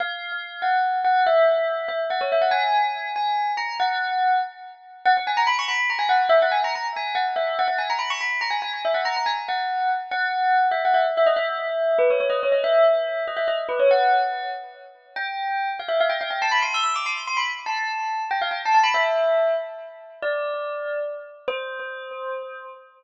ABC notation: X:1
M:6/8
L:1/16
Q:3/8=95
K:B
V:1 name="Tubular Bells"
^e6 f4 f2 | e6 e z f c e f | g6 g4 a2 | f6 z6 |
f f g a b c' b2 a g f2 | e f g a a z g2 f z e2 | f f g a b c' b2 a g g2 | e f a a g z f4 z2 |
f6 e f e z e d | e6 B c c d c d | e6 d e d z B c | f6 z6 |
[K:C] g6 f e f g f g | a b c' e' e' d' c'2 c' b z2 | a6 g f g a a b | e6 z6 |
d8 z4 | c12 |]